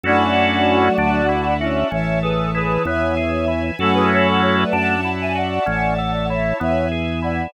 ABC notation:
X:1
M:12/8
L:1/16
Q:3/8=64
K:F#m
V:1 name="Choir Aahs"
[DF]10 [CE]2 [ce]2 [GB]2 [GB]2 [ce]6 | [FA] [GB] [Ac] [FA] [Ac] [Bd] [fa]3 [eg] [df]6 [ce]2 [ce]2 z2 [df]2 |]
V:2 name="Flute"
[F,A,]8 z4 E,12 | [F,A,]8 z16 |]
V:3 name="Drawbar Organ"
[CEFA]6 D2 E2 F2 C2 A2 E2 B,2 G2 E2 | [CEFA]6 D2 E2 F2 C2 A2 E2 B,2 G2 E2 |]
V:4 name="Drawbar Organ" clef=bass
F,,6 D,,6 A,,,6 E,,6 | F,,6 F,,6 A,,,6 E,,6 |]
V:5 name="String Ensemble 1"
[cefa]6 [defa]6 [cea]6 [Beg]6 | [cefa]6 [defa]6 [cea]6 [Beg]6 |]